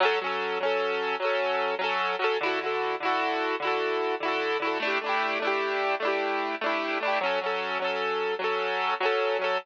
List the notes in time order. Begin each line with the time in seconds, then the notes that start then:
0.00 F#3 C#4
0.05 A4
0.21 F#3 C#4
0.26 A4
0.60 F#3 C#4
0.65 A4
1.20 F#3 C#4
1.25 A4
1.79 F#3 C#4
1.84 A4
2.19 F#3 C#4
2.24 A4
2.41 D3 E4
2.46 F#4 A4
2.59 D3 E4
2.64 F#4 A4
3.00 D3 E4
3.05 F#4 A4
3.60 D3 E4
3.65 F#4 A4
4.20 D3 E4
4.25 F#4 A4
4.60 D3 E4
4.65 F#4 A4
4.80 A3 D4
4.85 E4 G4
5.01 A3 D4
5.06 E4 G4
5.40 A3 D4
5.45 E4 G4
6.00 A3 D4
6.05 E4 G4
6.61 A3 D4
6.66 E4 G4
7.00 A3 D4
7.05 E4 G4
7.21 F#3 C#4
7.26 A4
7.41 F#3 C#4
7.46 A4
7.79 F#3 C#4
7.84 A4
8.39 F#3 C#4
8.44 A4
9.00 F#3 C#4
9.05 A4
9.39 F#3 C#4
9.44 A4